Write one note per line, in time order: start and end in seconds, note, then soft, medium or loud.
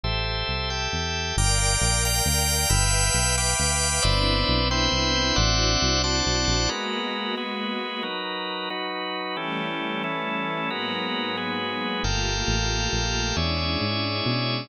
0.04 0.44 A1 medium
0.04 0.70 G4 medium
0.04 0.70 A4 medium
0.04 0.70 C5 medium
0.04 0.70 E5 medium
0.48 0.88 C2 medium
0.70 1.36 G4 medium
0.70 1.36 A4 medium
0.70 1.36 E5 medium
0.70 1.36 G5 medium
0.92 1.32 E2 medium
1.37 1.77 G1 loud
1.37 2.69 A#4 medium
1.37 2.69 D5 medium
1.37 2.69 F5 medium
1.37 2.69 G5 medium
1.37 2.04 G5 loud
1.37 2.04 A#5 medium
1.37 2.04 D6 loud
1.37 2.04 F6 medium
1.81 2.21 A#1 medium
2.05 2.69 G5 loud
2.05 2.71 A#5 loud
2.05 2.69 F6 loud
2.05 2.71 G6 loud
2.26 2.66 D2 medium
2.70 3.10 G1 loud
2.70 4.02 B4 medium
2.70 4.02 E5 medium
2.70 4.02 F5 medium
2.70 3.36 G5 loud
2.70 4.02 G5 medium
2.70 3.36 B5 loud
2.70 3.36 E6 loud
2.70 3.36 F6 loud
3.14 3.54 B1 medium
3.37 4.03 G5 loud
3.37 4.03 B5 loud
3.37 4.03 D6 loud
3.37 4.03 F6 loud
3.59 3.99 D2 medium
4.02 4.44 G1 loud
4.02 5.36 B3 medium
4.02 5.36 C4 medium
4.02 5.36 D4 medium
4.02 5.36 E4 medium
4.02 4.68 B4 loud
4.02 4.68 C5 loud
4.02 4.68 D5 loud
4.02 4.68 E5 loud
4.48 4.88 B1 medium
4.71 5.37 B4 loud
4.71 5.35 C5 loud
4.71 5.35 E5 loud
4.71 5.37 G5 loud
4.92 5.32 C2 medium
5.36 5.77 A1 loud
5.36 6.69 C4 medium
5.36 6.69 D4 medium
5.36 6.69 E4 medium
5.36 6.69 F#4 medium
5.36 6.02 C5 loud
5.36 6.02 D5 loud
5.36 6.02 E5 loud
5.36 6.02 F#5 loud
5.82 6.22 C2 medium
6.04 6.70 C5 loud
6.04 6.70 D5 loud
6.04 6.70 F#5 loud
6.04 6.70 A5 medium
6.26 6.46 B1 medium
6.48 6.68 A#1 medium
6.69 7.35 G#3 medium
6.69 8.02 G#3 medium
6.69 8.02 A#3 medium
6.69 8.02 B3 medium
6.69 7.35 F#4 medium
6.69 8.02 F#4 medium
6.69 7.35 A#4 medium
6.69 7.35 B4 medium
7.37 8.03 G#3 medium
7.37 8.03 F#4 medium
7.37 8.03 G#4 medium
7.37 8.02 B4 medium
8.03 8.69 F#3 medium
8.03 8.69 D#4 medium
8.03 8.69 A#4 medium
8.03 8.69 B4 medium
8.70 9.36 F#3 medium
8.70 9.36 D#4 medium
8.70 9.36 F#4 medium
8.70 9.36 B4 medium
9.37 10.02 E3 medium
9.37 10.69 E3 medium
9.37 10.69 G3 medium
9.37 10.69 A3 medium
9.37 10.02 C#4 medium
9.37 10.69 C#4 medium
9.37 10.02 G4 medium
9.37 10.02 A4 medium
10.04 10.70 E3 medium
10.04 10.70 C#4 medium
10.04 10.70 E4 medium
10.04 10.70 A4 medium
10.70 12.02 G#2 medium
10.70 12.02 F#3 medium
10.70 11.36 G#3 medium
10.70 12.02 A#3 medium
10.70 12.02 B3 medium
10.70 11.36 F#4 medium
10.70 11.36 A#4 medium
10.70 11.36 B4 medium
11.37 12.03 G#3 medium
11.37 12.03 F#4 medium
11.37 12.03 G#4 medium
11.37 12.03 B4 medium
12.03 12.43 G1 medium
12.03 13.35 A3 medium
12.03 13.35 A#3 medium
12.03 13.35 F4 medium
12.03 13.35 G4 medium
12.03 13.36 A4 medium
12.03 13.36 A#4 medium
12.03 13.36 F5 medium
12.03 13.36 G5 loud
12.48 12.88 A1 medium
12.93 13.33 A#1 medium
13.36 13.77 E2 medium
13.36 14.69 G#3 medium
13.36 14.69 C#4 medium
13.36 14.69 D4 medium
13.36 14.69 E4 medium
13.36 14.68 G#4 medium
13.36 14.68 C#5 medium
13.36 14.68 D5 medium
13.36 14.68 E5 medium
13.81 14.21 G#2 medium
14.26 14.66 B2 medium